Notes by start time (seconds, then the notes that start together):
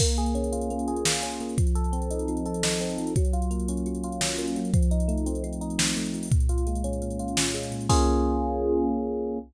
0.00 A#3, kick, crash
0.09 closed hi-hat
0.17 G#4, closed hi-hat
0.26 closed hi-hat
0.35 C#4, closed hi-hat
0.44 closed hi-hat
0.52 F4, closed hi-hat
0.61 closed hi-hat
0.70 A#3, closed hi-hat
0.79 closed hi-hat
0.88 G#4, closed hi-hat
0.96 closed hi-hat
1.05 F4, snare
1.14 closed hi-hat
1.23 C#4, closed hi-hat
1.32 closed hi-hat
1.40 A#3, closed hi-hat
1.49 closed hi-hat
1.57 F3, kick, closed hi-hat
1.67 closed hi-hat
1.75 A4, closed hi-hat
1.84 closed hi-hat
1.92 C4, closed hi-hat
2.02 closed hi-hat
2.11 D#4, closed hi-hat
2.19 closed hi-hat
2.28 F3, closed hi-hat
2.37 closed hi-hat
2.46 A4, closed hi-hat
2.54 closed hi-hat
2.63 D#4, snare
2.72 closed hi-hat
2.80 C4, closed hi-hat
2.89 closed hi-hat
2.98 F3, closed hi-hat
3.07 closed hi-hat
3.16 F#3, kick, closed hi-hat
3.25 closed hi-hat
3.33 F4, closed hi-hat
3.42 closed hi-hat
3.51 A#3, closed hi-hat
3.60 closed hi-hat
3.68 C#4, closed hi-hat
3.77 closed hi-hat
3.86 F#3, closed hi-hat
3.95 closed hi-hat
4.04 F4, closed hi-hat
4.12 closed hi-hat
4.21 C#4, snare
4.30 closed hi-hat
4.38 A#3, closed hi-hat
4.48 closed hi-hat
4.56 F#3, closed hi-hat
4.65 closed hi-hat
4.74 F3, kick, closed hi-hat
4.83 closed hi-hat
4.91 D#4, closed hi-hat
5.00 closed hi-hat
5.08 A3, closed hi-hat
5.18 closed hi-hat
5.26 C4, closed hi-hat
5.35 closed hi-hat
5.44 F3, closed hi-hat
5.53 closed hi-hat
5.61 D#4, closed hi-hat
5.70 closed hi-hat
5.78 C4, snare
5.88 closed hi-hat
5.96 A3, closed hi-hat
6.05 closed hi-hat
6.14 F3, closed hi-hat
6.23 open hi-hat
6.31 A#2, kick, closed hi-hat
6.40 closed hi-hat
6.49 F4, closed hi-hat
6.58 closed hi-hat
6.67 G#3, closed hi-hat
6.75 closed hi-hat
6.84 C#4, closed hi-hat
6.93 closed hi-hat
7.02 A#2, closed hi-hat
7.10 closed hi-hat
7.19 F4, closed hi-hat
7.28 closed hi-hat
7.37 C#4, snare
7.46 closed hi-hat
7.54 G#3, closed hi-hat
7.63 closed hi-hat
7.71 A#2, closed hi-hat
7.81 closed hi-hat
7.89 A#3 C#4 F4 G#4, kick, crash